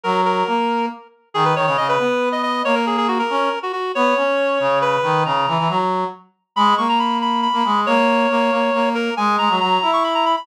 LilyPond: <<
  \new Staff \with { instrumentName = "Clarinet" } { \time 6/8 \key gis \minor \tempo 4. = 92 ais'8 ais'4. r4 | gis'16 b'16 cis''16 cis''16 dis''16 b'4 dis''16 dis''8 | cis''16 ais'16 gis'16 gis'16 fis'16 ais'4 fis'16 fis'8 | cis''2 b'4 |
ais''4. r4. | b''8 cis'''16 ais''16 b''8 b''8 b''4 | cis''2~ cis''8 ais'8 | gis''8 ais''8 ais''8. cis'''16 b''16 ais''16 b''16 b''16 | }
  \new Staff \with { instrumentName = "Brass Section" } { \time 6/8 \key gis \minor fis4 ais4 r4 | dis8 dis16 cis16 cis8 b4. | ais4. cis'8 r4 | b8 cis'4 cis4 dis8 |
cis8 e16 e16 fis4 r4 | gis8 ais4.~ ais16 ais16 gis8 | ais4 ais8 ais8 ais4 | gis8 gis16 fis16 fis8 e'4. | }
>>